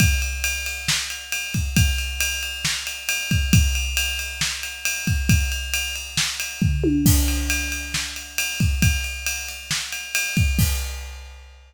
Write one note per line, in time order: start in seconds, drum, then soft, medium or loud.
0.00 kick loud
0.00 ride loud
0.22 ride medium
0.44 ride loud
0.66 ride medium
0.88 snare loud
1.10 ride medium
1.32 ride loud
1.54 kick medium
1.54 ride medium
1.76 kick loud
1.76 ride loud
1.98 ride medium
2.20 ride loud
2.43 ride medium
2.65 snare loud
2.87 ride medium
3.09 ride loud
3.31 kick loud
3.31 ride medium
3.53 kick loud
3.53 ride loud
3.75 ride medium
3.97 ride loud
4.19 ride medium
4.41 snare loud
4.63 ride medium
4.85 ride loud
5.07 kick loud
5.07 ride medium
5.29 kick loud
5.29 ride loud
5.52 ride medium
5.74 ride loud
5.96 ride medium
6.17 snare loud
6.40 ride loud
6.62 kick loud
6.62 floor tom medium
6.84 high tom loud
7.06 kick loud
7.06 crash loud
7.28 ride medium
7.50 ride loud
7.72 ride medium
7.94 snare loud
8.16 ride medium
8.38 ride loud
8.60 kick loud
8.60 ride medium
8.82 kick loud
8.82 ride loud
9.04 ride medium
9.26 ride loud
9.49 ride medium
9.71 snare loud
9.92 ride medium
10.15 ride loud
10.37 kick loud
10.37 ride medium
10.59 kick loud
10.59 crash loud